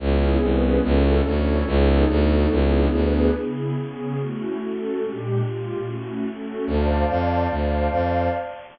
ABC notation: X:1
M:6/8
L:1/8
Q:3/8=144
K:C#m
V:1 name="Pad 2 (warm)"
[B,CEG]3 [B,CGB]3 | [CEFA]3 [CEAc]3 | [B,DGA]3 [B,DFA]3 | [B,=DEG]3 [B,DGB]3 |
[C,B,EG]3 [C,B,CG]3 | [A,CEF]3 [A,CFA]3 | [_B,,_A,=D=G]3 [B,,A,=FG]3 | [A,CEF]3 [A,CFA]3 |
[K:Dm] [cdfa]6 | [cdfa]6 |]
V:2 name="Violin" clef=bass
C,,3 ^B,,,3 | C,,3 =D,,3 | C,,3 =D,,3 | C,,3 =D,,3 |
z6 | z6 | z6 | z6 |
[K:Dm] D,,3 F,,3 | D,,3 F,,3 |]